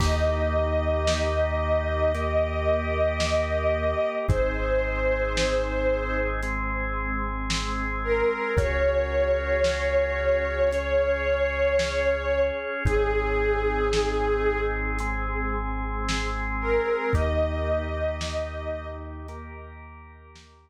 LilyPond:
<<
  \new Staff \with { instrumentName = "Pad 5 (bowed)" } { \time 4/4 \key ees \mixolydian \tempo 4 = 56 ees''1 | c''2 r4. bes'8 | des''1 | aes'2 r4. bes'8 |
ees''2 r2 | }
  \new Staff \with { instrumentName = "Drawbar Organ" } { \time 4/4 \key ees \mixolydian <bes ees' g'>2 <bes g' bes'>2 | <c' ees' aes'>2 <aes c' aes'>2 | <des' ges' aes'>2 <des' aes' des''>2 | <c' ees' aes'>2 <aes c' aes'>2 |
<bes ees' g'>2 <bes g' bes'>2 | }
  \new Staff \with { instrumentName = "Synth Bass 2" } { \clef bass \time 4/4 \key ees \mixolydian ees,1 | aes,,1 | des,1 | aes,,1 |
ees,1 | }
  \new DrumStaff \with { instrumentName = "Drums" } \drummode { \time 4/4 <cymc bd>4 sn4 hh4 sn4 | <hh bd>4 sn4 hh4 sn4 | <hh bd>4 sn4 hh4 sn4 | <hh bd>4 sn4 hh4 sn4 |
<hh bd>4 sn4 hh4 sn4 | }
>>